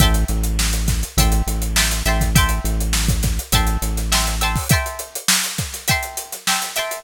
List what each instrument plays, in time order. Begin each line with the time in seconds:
0.00 synth bass 1 A1, acoustic guitar (steel) E5 G5 A5 C6, kick, closed hi-hat
0.14 closed hi-hat
0.28 synth bass 1 A1, closed hi-hat
0.44 closed hi-hat
0.59 snare
0.73 closed hi-hat
0.88 kick, snare, closed hi-hat
1.03 closed hi-hat
1.17 synth bass 1 A1, acoustic guitar (steel) E5 G5 A5 C6, kick, closed hi-hat
1.32 closed hi-hat
1.47 synth bass 1 A1, closed hi-hat
1.62 closed hi-hat
1.76 acoustic guitar (steel) E5 G5 A5 C6, snare
1.91 closed hi-hat
2.06 synth bass 1 A1, acoustic guitar (steel) E5 G5 A5 C6, closed hi-hat
2.21 kick, snare, closed hi-hat
2.35 acoustic guitar (steel) E5 G5 A5 C6, kick, closed hi-hat
2.49 closed hi-hat
2.64 synth bass 1 A1, closed hi-hat
2.81 closed hi-hat
2.93 snare
3.08 kick, closed hi-hat
3.23 kick, snare, closed hi-hat
3.39 closed hi-hat
3.52 synth bass 1 A1, acoustic guitar (steel) E5 G5 A5 C6, kick, closed hi-hat
3.67 closed hi-hat
3.82 synth bass 1 A1, closed hi-hat
3.97 snare, closed hi-hat
4.12 acoustic guitar (steel) E5 G5 A5 C6, snare
4.27 closed hi-hat
4.41 acoustic guitar (steel) E5 G5 A5 C6, closed hi-hat
4.55 kick, snare, open hi-hat
4.69 acoustic guitar (steel) E5 G5 A5, kick, closed hi-hat
4.73 acoustic guitar (steel) C6
4.86 closed hi-hat
4.99 closed hi-hat
5.15 closed hi-hat
5.28 snare
5.44 closed hi-hat
5.58 kick, snare, closed hi-hat
5.73 snare, closed hi-hat
5.88 acoustic guitar (steel) E5 G5 A5 C6, kick, closed hi-hat
6.03 closed hi-hat
6.17 closed hi-hat
6.32 snare, closed hi-hat
6.47 acoustic guitar (steel) E5 G5 A5 C6, snare
6.62 closed hi-hat
6.76 acoustic guitar (steel) E5 G5 A5 C6, closed hi-hat
6.91 closed hi-hat